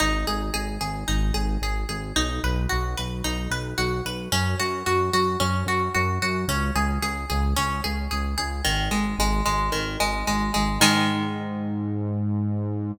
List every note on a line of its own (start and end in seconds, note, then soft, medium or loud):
0.00 0.24 G#1 loud
0.00 0.24 D#4 loud
0.27 0.50 G#1 medium
0.27 0.52 G#4 medium
0.54 0.78 G#1 medium
0.54 0.78 G#4 medium
0.81 1.04 G#1 loud
0.81 1.05 G#4 medium
1.08 1.31 G#1 medium
1.08 1.32 D#4 medium
1.34 1.57 G#1 medium
1.34 1.59 G#4 medium
1.62 1.85 G#1 medium
1.62 1.87 G#4 medium
1.89 2.12 G#1 medium
1.89 2.13 G#4 medium
2.16 2.39 B1 loud
2.16 2.40 D#4 medium
2.44 2.67 B1 loud
2.44 2.68 B4 medium
2.69 2.95 B1 medium
2.69 2.94 F#4 medium
2.97 3.22 B1 medium
2.97 3.22 B4 medium
3.24 3.48 B1 medium
3.24 3.49 D#4 medium
3.51 3.74 B1 medium
3.51 3.76 B4 medium
3.78 4.01 B1 medium
3.78 4.02 F#4 medium
4.05 4.28 B1 medium
4.05 4.30 B4 medium
4.32 4.55 F#2 loud
4.32 4.56 C#4 loud
4.60 4.83 F#2 medium
4.60 4.84 F#4 medium
4.86 5.10 F#2 medium
4.86 5.11 F#4 medium
5.13 5.36 F#2 medium
5.13 5.38 F#4 medium
5.40 5.64 F#2 medium
5.40 5.64 C#4 medium
5.66 5.89 F#2 medium
5.66 5.92 F#4 medium
5.94 6.19 F#2 loud
5.94 6.19 F#4 medium
6.22 6.45 F#2 loud
6.22 6.47 F#4 medium
6.48 6.71 C#2 loud
6.48 6.73 C#4 medium
6.76 6.99 C#2 loud
6.76 7.00 G#4 medium
7.02 7.25 C#2 medium
7.02 7.27 G#4 medium
7.30 7.54 C#2 loud
7.30 7.54 G#4 medium
7.56 7.81 C#2 medium
7.56 7.81 C#4 medium
7.84 8.08 C#2 medium
7.84 8.08 G#4 medium
8.11 8.35 C#2 medium
8.11 8.35 G#4 medium
8.38 8.61 C#2 medium
8.38 8.62 G#4 medium
8.65 8.89 G#1 loud
8.65 8.89 D#3 medium
8.91 9.14 G#1 medium
8.91 9.15 G#3 medium
9.19 9.42 G#1 loud
9.19 9.44 G#3 medium
9.45 9.70 G#1 medium
9.45 9.70 G#3 medium
9.72 9.97 G#1 medium
9.72 9.96 D#3 medium
10.00 10.23 G#1 medium
10.00 10.24 G#3 medium
10.27 10.51 G#1 medium
10.27 10.52 G#3 medium
10.54 10.78 G#1 medium
10.54 10.78 G#3 medium
10.80 12.92 G#2 loud
10.80 12.93 D#3 loud
10.80 12.93 G#3 loud